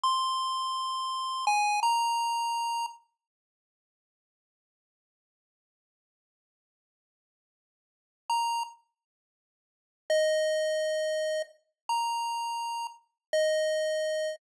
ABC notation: X:1
M:4/4
L:1/8
Q:1/4=167
K:Fm
V:1 name="Lead 1 (square)"
c'8 | a2 b6 | z8 | z8 |
z8 | [K:Ab] z6 b2 | z8 | e8 |
z2 b6 | [K:Fm] z2 e6 |]